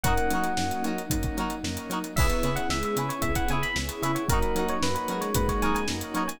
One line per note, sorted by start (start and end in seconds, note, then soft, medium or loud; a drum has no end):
0.04 0.18 F#2 loud
0.04 0.52 F#3 loud
0.04 2.15 F#3 medium
0.04 0.26 A#3 loud
0.04 0.52 A#3 loud
0.04 2.15 A#3 medium
0.04 0.52 C#4 loud
0.04 2.15 C#4 medium
0.04 0.52 D#4 loud
0.04 2.15 D#4 medium
0.04 0.14 F#4 loud
0.04 0.14 A#4 loud
0.04 0.14 C#5 loud
0.04 0.89 F#5 medium
0.04 kick medium
0.04 closed hi-hat medium
0.08 0.14 D#4 medium
0.17 closed hi-hat medium
0.31 0.45 F#3 medium
0.31 1.02 F#3 loud
0.31 0.51 F#4 medium
0.31 0.51 A#4 medium
0.31 0.51 C#5 medium
0.31 closed hi-hat medium
0.36 0.51 D#4 medium
0.44 closed hi-hat medium
0.57 0.72 F#2 medium
0.57 1.05 F#3 medium
0.57 1.05 A#3 medium
0.57 1.05 C#4 medium
0.57 1.05 D#4 medium
0.57 snare medium
0.70 snare soft
0.70 closed hi-hat medium
0.84 0.99 F#3 medium
0.84 1.03 D#4 loud
0.84 1.03 F#4 medium
0.84 1.03 A#4 medium
0.84 1.03 C#5 loud
0.84 closed hi-hat medium
0.98 closed hi-hat medium
1.10 1.25 F#2 loud
1.10 1.59 F#3 medium
1.10 1.59 A#3 loud
1.10 1.59 C#4 medium
1.10 1.59 D#4 loud
1.10 kick medium
1.10 closed hi-hat medium
1.23 kick medium
1.23 closed hi-hat medium
1.37 1.52 F#3 medium
1.37 1.56 D#4 medium
1.37 1.56 F#4 medium
1.37 1.56 A#4 medium
1.37 1.56 C#5 loud
1.37 closed hi-hat medium
1.50 closed hi-hat medium
1.63 1.78 F#2 loud
1.63 2.12 F#3 medium
1.63 2.12 A#3 medium
1.63 2.12 C#4 medium
1.63 2.12 D#4 medium
1.63 snare medium
1.77 closed hi-hat medium
1.90 2.04 F#3 loud
1.90 1.99 D#4 medium
1.90 1.99 F#4 loud
1.90 1.99 A#4 medium
1.90 1.99 C#5 medium
1.90 closed hi-hat medium
2.04 closed hi-hat medium
2.16 2.32 C#2 loud
2.16 4.27 B3 medium
2.16 2.50 B3 loud
2.16 2.65 B3 loud
2.16 4.27 C#4 medium
2.16 2.65 C#4 medium
2.16 4.27 E4 medium
2.16 2.65 E4 loud
2.16 4.27 G#4 medium
2.16 2.65 G#4 loud
2.16 2.27 G#4 loud
2.16 2.27 B4 loud
2.16 2.27 C#5 loud
2.16 2.55 E5 medium
2.16 kick loud
2.16 crash medium
2.21 2.27 E4 loud
2.30 closed hi-hat medium
2.43 2.58 C#3 loud
2.43 2.62 E4 medium
2.43 2.62 G#4 medium
2.43 2.62 B4 medium
2.43 2.62 C#5 medium
2.43 closed hi-hat medium
2.56 2.70 E4 medium
2.56 2.68 F#5 medium
2.56 closed hi-hat medium
2.69 2.84 C#2 medium
2.69 2.94 G#3 loud
2.69 3.17 B3 medium
2.69 3.17 C#4 medium
2.69 3.17 E4 medium
2.69 3.17 G#4 medium
2.69 2.83 E5 medium
2.69 snare medium
2.83 3.09 E5 medium
2.83 closed hi-hat medium
2.96 3.11 C#3 loud
2.96 3.09 C#4 loud
2.96 3.15 E4 medium
2.96 3.15 G#4 medium
2.96 3.15 B4 medium
2.96 3.15 C#5 medium
2.96 closed hi-hat medium
3.09 3.22 C#4 loud
3.09 3.22 C#5 medium
3.09 closed hi-hat medium
3.22 3.37 C#2 loud
3.22 3.70 B3 medium
3.22 3.70 C#4 medium
3.22 3.70 E4 medium
3.22 3.45 E4 loud
3.22 3.70 G#4 medium
3.22 3.34 E5 medium
3.22 kick medium
3.22 closed hi-hat medium
3.35 3.48 F#5 medium
3.35 kick medium
3.35 closed hi-hat medium
3.48 3.64 C#3 loud
3.48 3.68 G#4 loud
3.48 3.68 B4 medium
3.48 3.68 C#5 medium
3.48 3.63 G#5 medium
3.48 closed hi-hat medium
3.53 3.68 E4 medium
3.62 3.75 B5 medium
3.62 snare soft
3.62 closed hi-hat medium
3.76 3.90 C#2 loud
3.76 4.24 B3 medium
3.76 4.24 C#4 medium
3.76 4.24 E4 medium
3.76 4.24 G#4 medium
3.76 snare medium
3.89 snare soft
3.89 closed hi-hat medium
4.02 4.17 C#3 loud
4.02 4.23 E4 loud
4.02 4.12 G#4 medium
4.02 4.12 B4 loud
4.02 4.12 C#5 loud
4.02 4.15 E5 medium
4.02 closed hi-hat medium
4.06 4.12 E4 loud
4.15 4.28 C#5 medium
4.15 closed hi-hat medium
4.28 4.43 F#2 loud
4.28 4.96 F#3 loud
4.28 6.38 A#3 medium
4.28 4.77 A#3 loud
4.28 6.38 C#4 medium
4.28 4.77 C#4 loud
4.28 6.38 D#4 medium
4.28 4.77 D#4 loud
4.28 6.38 F#4 medium
4.28 4.77 F#4 loud
4.28 4.65 A#4 medium
4.28 4.39 A#4 medium
4.28 4.39 C#5 loud
4.28 kick medium
4.28 closed hi-hat medium
4.32 4.39 D#4 loud
4.32 4.39 F#4 loud
4.42 closed hi-hat medium
4.55 4.70 F#3 medium
4.55 4.75 F#4 medium
4.55 4.75 A#4 medium
4.55 4.75 C#5 medium
4.55 closed hi-hat medium
4.60 4.75 D#4 medium
4.68 4.82 C#5 medium
4.68 closed hi-hat medium
4.82 4.97 F#2 loud
4.82 5.30 A#3 medium
4.82 5.30 C#4 medium
4.82 5.30 D#4 medium
4.82 5.30 F#4 medium
4.82 4.94 B4 medium
4.82 snare loud
4.95 5.20 B4 medium
4.95 closed hi-hat medium
5.08 5.23 F#3 loud
5.08 5.85 G#3 loud
5.08 5.28 F#4 medium
5.08 5.28 A#4 medium
5.08 5.28 C#5 medium
5.08 closed hi-hat medium
5.12 5.28 D#4 medium
5.21 5.34 C#5 medium
5.21 snare soft
5.21 closed hi-hat medium
5.35 5.49 F#2 loud
5.35 5.84 A#3 medium
5.35 5.84 C#4 loud
5.35 5.84 D#4 medium
5.35 5.84 F#4 medium
5.35 5.48 B4 medium
5.35 kick medium
5.35 closed hi-hat medium
5.48 5.62 C#5 medium
5.48 kick medium
5.48 snare soft
5.48 closed hi-hat medium
5.62 5.77 F#3 loud
5.62 5.81 D#4 medium
5.62 5.81 F#4 medium
5.62 5.81 A#4 medium
5.62 5.81 C#5 medium
5.62 5.74 G#5 medium
5.62 snare soft
5.62 closed hi-hat medium
5.74 5.87 G#5 medium
5.74 snare soft
5.74 closed hi-hat medium
5.88 6.03 F#2 medium
5.88 6.37 A#3 medium
5.88 6.37 C#4 medium
5.88 6.37 D#4 medium
5.88 6.37 F#4 medium
5.88 snare loud
6.01 closed hi-hat medium
6.14 6.29 F#3 loud
6.14 6.23 D#4 medium
6.14 6.23 F#4 medium
6.14 6.23 A#4 medium
6.14 6.23 C#5 loud
6.14 6.29 C#5 medium
6.14 closed hi-hat medium
6.28 6.40 G#5 medium
6.28 closed hi-hat medium